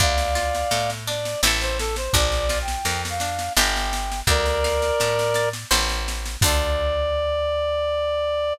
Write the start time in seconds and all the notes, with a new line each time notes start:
0.00 D2 D4 D5 F5, kick, snare
0.18 snare
0.35 F4, snare
0.55 snare
0.71 A2 A4, snare
0.90 snare
1.07 D4 D5, snare
1.25 snare
1.43 A1 C4 E4, snare
1.47 A4
1.61 C5, snare
1.79 A4, snare
1.96 C5, snare
2.13 A#1 D4 D5, kick, snare
2.32 snare
2.49 F4, snare
2.62 G5
2.68 snare
2.85 F2 A#4, snare
3.05 snare
3.10 F5
3.20 D4, snare
3.39 snare
3.57 G1 D4 G4 G5, snare
3.61 A#4
3.76 snare
3.93 snare
4.12 snare
4.27 D2 A#4 D5, kick, snare
4.46 snare
4.64 F5, snare
4.82 snare
5.00 A2 A5, snare
5.19 snare
5.34 D5, snare
5.53 snare
5.71 A1 C5 E5, snare
5.75 A5
5.89 snare
6.08 snare
6.25 snare
6.41 D2 D4 D5, kick, crash
6.46 F4 A4